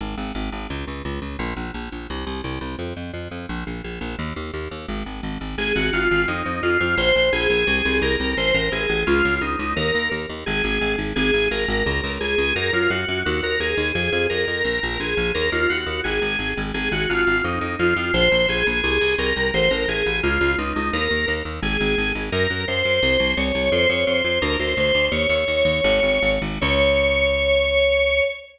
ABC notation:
X:1
M:2/2
L:1/8
Q:1/2=86
K:Db
V:1 name="Drawbar Organ"
z8 | z8 | z8 | z8 |
A G F2 E2 F F | c2 A4 B2 | c B A2 F2 E E | B2 z2 A3 z |
A2 B4 A2 | B F G2 G B A2 | A2 B4 A2 | B F G2 A3 z |
A G F2 E2 F F | c2 A4 B2 | c B A2 F2 E E | B2 z2 A3 z |
B2 c4 d2 | c d c2 B c c2 | "^rit." d7 z | d8 |]
V:2 name="Electric Bass (finger)" clef=bass
A,,, A,,, A,,, A,,, D,, D,, D,, D,, | B,,, B,,, B,,, B,,, C,, C,, C,, C,, | F,, F,, F,, F,, B,,, B,,, B,,, B,,, | E,, E,, E,, E,, A,,, A,,, A,,, A,,, |
A,,, A,,, A,,, A,,, F,, F,, F,, F,, | B,,, B,,, B,,, B,,, C,, C,, C,, C,, | =A,,, A,,, A,,, A,,, D,, D,, D,, D,, | E,, E,, E,, E,, A,,, A,,, A,,, A,,, |
A,,, A,,, A,,, A,,, D,, D,, D,, D,, | G,, G,, G,, G,, E,, E,, E,, E,, | F,, F,, F,, F,, B,,, B,,, B,,, B,,, | E,, E,, E,, E,, A,,, A,,, A,,, A,,, |
A,,, A,,, A,,, A,,, F,, F,, F,, F,, | B,,, B,,, B,,, B,,, C,, C,, C,, C,, | =A,,, A,,, A,,, A,,, D,, D,, D,, D,, | E,, E,, E,, E,, A,,, A,,, A,,, A,,, |
G,, G,, G,, G,, C,, C,, C,, C,, | F,, F,, F,, F,, =D,, D,, D,, D,, | "^rit." E,, E,, E,, E,, A,,, A,,, A,,, A,,, | D,,8 |]